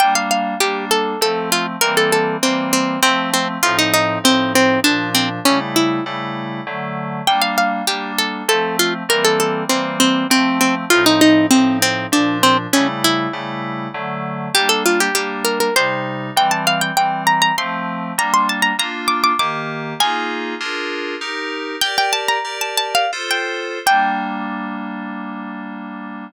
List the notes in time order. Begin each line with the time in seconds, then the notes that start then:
0.00 G3 A#3 D4 G5
0.15 F5
0.31 F5
0.60 G3 A#3 D4 G4
0.91 A4
1.21 F3 A3 C4 A4
1.52 F4
1.81 E3 G3 A#3 C4 A#4
1.97 A4
2.12 A4
2.43 E3 G3 A#3 C4
2.73 C4
3.03 F3 A3 C4
3.34 C4
3.63 A2 F3 C4 D#4 F4
3.79 D#4
3.94 D#4
4.24 A2 F3 C4 D#4
4.55 C4
4.84 A#2 F3 D4
5.15 C4
5.45 C#3 G3 A3 C#4 E4
5.76 E4
6.06 C#3 G3 A3 E4
6.67 D3 F#3 A3
7.27 G3 A#3 D4 G5
7.42 F5
7.58 F5
7.87 G3 A#3 D4 G4
8.18 A4
8.48 F3 A3 C4 A4
8.79 F4
9.09 E3 G3 A#3 C4 A#4
9.24 A4
9.40 A4
9.69 E3 G3 A#3 C4
10.00 C4
10.30 F3 A3 C4
10.61 C4
10.90 A2 F3 C4 D#4 F4
11.06 D#4
11.21 D#4
11.51 A2 F3 C4 D#4
11.82 C4
12.12 A#2 F3 D4
12.43 C4
12.73 C#3 G3 A3 C#4 E4
13.04 E4
13.33 C#3 G3 A3 E4
13.94 D3 F#3 A3
14.54 G3 A#3 D4 G4
14.69 A4
14.86 F4
15.00 G4
15.15 G3 A#3 D4 G4
15.45 A#4
15.60 A#4
15.76 C3 G3 D#4 C5
16.36 E3 G3 C4 G5
16.51 A5
16.67 F5
16.81 G5
16.97 E3 G3 C4 G5
17.27 A#5
17.42 A#5
17.58 F3 A3 C4 C6
18.18 G3 A#3 D4 A#5
18.34 C6
18.49 A5
18.62 A#5
18.79 A#3 D4 F4 A#5
19.08 D6
19.24 D6
19.39 D#3 A#3 G4 D6
20.00 A#3 D#4 F4 G#4 G#5
20.60 D4 F4 G#4 A#4
21.21 D#4 G4 A#4
21.81 G4 A#4 D5 G5
21.98 G5
22.13 A5
22.28 A#5
22.45 G4 A#4 D5
22.61 A5
22.77 A5
22.95 F5
23.13 F4 A4 C5
23.31 G5
23.86 G3 A#3 D4 G5